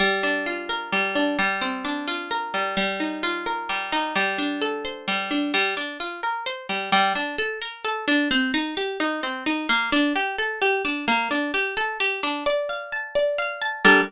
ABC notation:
X:1
M:3/4
L:1/8
Q:1/4=130
K:Gm
V:1 name="Orchestral Harp"
G, D F B G, D | G, C D F B G, | G, E F B G, E | G, D A c G, D |
G, D F B c G, | G, D A B A D | C E G E C E | B, D G A G D |
B, D G A G D | d f a d f a | [G,DAB]2 z4 |]